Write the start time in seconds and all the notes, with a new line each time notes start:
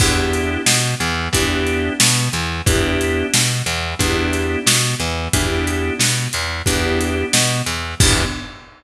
0.00 E2 B3 D4 E4 G4, kick, crash
0.33 closed hi-hat
0.66 B2 B3, snare
1.00 E2 E3, closed hi-hat
1.33 E2 B3 D4 E4 G4, kick, closed hi-hat
1.67 closed hi-hat
2.00 B2 B3, snare
2.32 E2 E3, closed hi-hat
2.66 E2 B3 D4 E4 G4, kick, closed hi-hat
3.01 closed hi-hat
3.34 B2 B3, snare
3.66 E2 E3, closed hi-hat
3.99 E2 B3 D4 E4 G4, kick, closed hi-hat
4.33 closed hi-hat
4.66 B2 B3, snare
5.00 E2 E3, closed hi-hat
5.33 E2 B3 D4 E4 G4, kick, closed hi-hat
5.67 closed hi-hat
5.99 B2 B3, snare
6.33 E2 E3, closed hi-hat
6.66 E2 B3 D4 E4 G4, kick, closed hi-hat
7.01 closed hi-hat
7.33 B2 B3, snare
7.66 E2 E3, closed hi-hat
8.00 E2 B3 D4 E4 G4, kick, crash